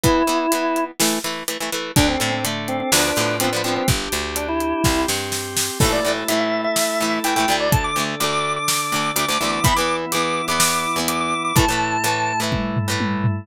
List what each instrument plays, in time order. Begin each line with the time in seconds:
0.04 acoustic guitar (steel) E3 B3, drawbar organ E4, kick, closed hi-hat
0.27 acoustic guitar (steel) E3 B3, closed hi-hat
0.52 acoustic guitar (steel) E3 B3, closed hi-hat
0.76 closed hi-hat
1.00 acoustic guitar (steel) E3 A3, snare
1.24 acoustic guitar (steel) E3 A3, closed hi-hat
1.48 acoustic guitar (steel) E3 A3, closed hi-hat
1.60 acoustic guitar (steel) E3 A3
1.72 acoustic guitar (steel) E3 A3, closed hi-hat
1.96 electric bass (finger) D2, acoustic guitar (steel) D3 A3, drawbar organ D4 A4, kick, closed hi-hat
2.08 drawbar organ C4
2.20 electric bass (finger) A2, acoustic guitar (steel) D3 A3, drawbar organ C4, closed hi-hat
2.33 drawbar organ C4
2.44 acoustic guitar (steel) D3 A3, closed hi-hat
2.68 drawbar organ C4, closed hi-hat
2.80 drawbar organ C4
2.92 electric bass (finger) D2, acoustic guitar (steel) D3 F3 B3, drawbar organ D4 F4 B4, snare
3.16 electric bass (finger) A2, acoustic guitar (steel) D3 F3, closed hi-hat
3.20 acoustic guitar (steel) B3
3.40 acoustic guitar (steel) D3 F3 B3, drawbar organ C4, closed hi-hat
3.53 acoustic guitar (steel) D3 F3 B3
3.64 acoustic guitar (steel) D3 F3 B3, drawbar organ C4, closed hi-hat
3.76 drawbar organ C4
3.88 electric bass (finger) G1, drawbar organ D4 G4, kick, closed hi-hat
4.12 electric bass (finger) D2, closed hi-hat
4.36 drawbar organ D4, closed hi-hat
4.48 drawbar organ E4
4.60 closed hi-hat
4.84 electric bass (finger) C2, drawbar organ C4 G4, kick, snare
5.08 electric bass (finger) G2, snare
5.32 snare
5.57 snare
5.80 acoustic guitar (steel) A2 E3, drawbar organ A3 E4 A4, kick, crash
5.84 acoustic guitar (steel) A3
5.92 drawbar organ D5
6.05 acoustic guitar (steel) A2 E3 A3
6.28 acoustic guitar (steel) A2 E3 A3, drawbar organ E5, closed hi-hat
6.40 drawbar organ E5
6.64 drawbar organ E5
6.76 snare
7.00 acoustic guitar (steel) A2 E3 A3
7.24 acoustic guitar (steel) A2 E3, drawbar organ G5, closed hi-hat
7.28 acoustic guitar (steel) A3
7.36 acoustic guitar (steel) A2 E3 A3, drawbar organ G5
7.48 acoustic guitar (steel) D2 D3 A3
7.60 drawbar organ D5
7.72 drawbar organ D3 D4 A4 A5, kick, closed hi-hat
7.84 drawbar organ D6
7.96 acoustic guitar (steel) D2 D3 A3
8.20 acoustic guitar (steel) D2 D3 A3, drawbar organ D6, closed hi-hat
8.32 drawbar organ D6
8.56 drawbar organ D6
8.68 snare
8.92 acoustic guitar (steel) D2 D3 A3
9.16 acoustic guitar (steel) D2 D3 A3, drawbar organ D6, closed hi-hat
9.28 acoustic guitar (steel) D2 D3 A3, drawbar organ D6
9.40 acoustic guitar (steel) D2 D3 A3, drawbar organ E3 B3 E4
9.52 drawbar organ D6
9.64 acoustic guitar (steel) E2 E3 B3, drawbar organ B5, kick, closed hi-hat
9.76 acoustic guitar (steel) E2 E3, drawbar organ D6
9.80 acoustic guitar (steel) B3
10.12 acoustic guitar (steel) E2 E3, drawbar organ D6, closed hi-hat
10.16 acoustic guitar (steel) B3
10.24 drawbar organ D6
10.48 acoustic guitar (steel) E2 E3 B3, drawbar organ D6
10.60 snare
10.96 acoustic guitar (steel) E2 E3 B3
11.08 drawbar organ D6, closed hi-hat
11.20 drawbar organ D6
11.45 drawbar organ D6
11.56 acoustic guitar (steel) A2 E3 A3, drawbar organ A2 A3 E4 A5, kick, closed hi-hat
11.68 acoustic guitar (steel) A2 E3 A3
12.04 acoustic guitar (steel) A2 E3 A3, closed hi-hat
12.40 acoustic guitar (steel) A2 E3 A3
12.52 kick, high tom
12.76 floor tom
12.88 acoustic guitar (steel) A2 E3 A3
13.00 high tom
13.24 floor tom